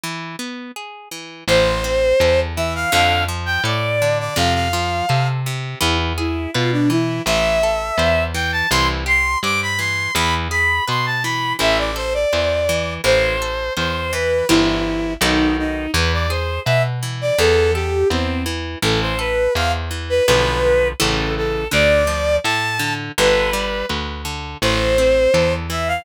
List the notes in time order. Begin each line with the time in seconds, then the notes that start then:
0.03 E3
0.39 B3
0.76 G#4
1.11 E3
1.48 A1 E3 C5
1.84 C4
2.20 E2 A4
2.56 E3 E5
2.75 F5
2.92 F2 D3 F5
3.28 F3
3.46 G5
3.64 A2 A4 D5
4.02 D3
4.20 D5
4.36 F2 C3 F5
4.54 F5
4.73 F3
5.09 C3 A4
5.46 C3
5.80 E2 E3 E4
6.18 E4 G#4
6.54 B2 F4 B4
6.72 D4
6.90 E3 E4
7.26 A1 E3 E5
7.63 A4
7.98 E2 C5
8.34 E3 G5
8.52 A5
8.70 C2 E3 C6
9.06 G4 C6
9.43 G2 C5 D6
9.62 B5
9.79 E3 C6
10.15 E2 E3 B5
10.51 G#4 B5
10.88 B2 B4 C6
11.06 A5
11.23 E3 B5
11.59 A1 E3 E5
11.78 D5
11.96 A4 C5
12.14 D5
12.33 E2 C5
12.69 E3
13.04 A1 E3 C5
13.42 A4
13.77 E2 C5
14.13 E3 B4
14.49 G1 E3 E4 G4 C5
15.21 B1 D#3 D#4 F#4 A4 B4
15.59 D#4
15.94 E2 E3 B4
16.13 D5
16.30 G#4 C5
16.65 B2 B4 E5
17.03 E3
17.21 D5
17.38 E2 E3 A4
17.74 G4 A4
18.10 E2 C4 C5
18.46 E3
18.82 A1 E3 A4
19.01 C5
19.19 A4 B4
19.55 E2 C5 F5
19.91 E3
20.09 B4
20.27 B1 D3 F3 B4
21.00 A1 C#3 E3 A4
21.37 A4
21.71 D2 D3 D5
22.07 F3
22.44 A2 A4 A5
22.79 D3
23.18 G1 D3 B4
23.53 G3
23.89 D2 B4
24.25 D3
24.62 A1 E3 C5
24.98 C4
25.34 E2 A4
25.70 E3 E5
25.88 F5